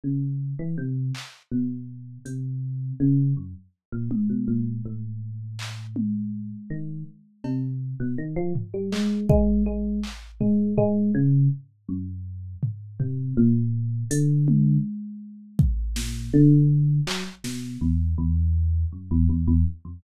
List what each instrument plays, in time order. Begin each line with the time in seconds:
0.04 electric piano 1 C#3
0.59 electric piano 1 E3
0.78 electric piano 1 C3
1.15 clap
1.52 electric piano 1 B2
2.25 electric piano 1 C3, closed hi-hat
3.00 electric piano 1 C#3
3.37 electric piano 1 F#2
3.92 electric piano 1 A#2
4.11 electric piano 1 G#2, high tom
4.30 electric piano 1 B2
4.48 electric piano 1 A#2
4.85 electric piano 1 A2
5.59 clap
5.96 high tom
6.70 electric piano 1 D#3
7.44 electric piano 1 C3, cowbell
8.00 electric piano 1 B2
8.18 electric piano 1 D#3
8.36 electric piano 1 F3
8.55 floor tom
8.74 electric piano 1 G3
8.92 electric piano 1 G#3, clap
9.29 electric piano 1 G#3, kick
9.66 electric piano 1 G#3
10.04 clap
10.41 electric piano 1 G#3, floor tom
10.78 electric piano 1 G#3, floor tom
11.15 electric piano 1 C#3
11.89 electric piano 1 F#2
12.63 floor tom
13.00 electric piano 1 C3, floor tom
13.37 electric piano 1 A#2
14.11 electric piano 1 D3, closed hi-hat
14.48 high tom
15.59 kick
15.96 electric piano 1 A#2, snare
16.33 electric piano 1 D3
17.07 electric piano 1 F#3, clap
17.44 electric piano 1 B2, snare
17.81 electric piano 1 E2
18.18 electric piano 1 E2
18.92 electric piano 1 F#2
19.11 electric piano 1 E2
19.29 electric piano 1 E2
19.48 electric piano 1 E2
19.85 electric piano 1 F2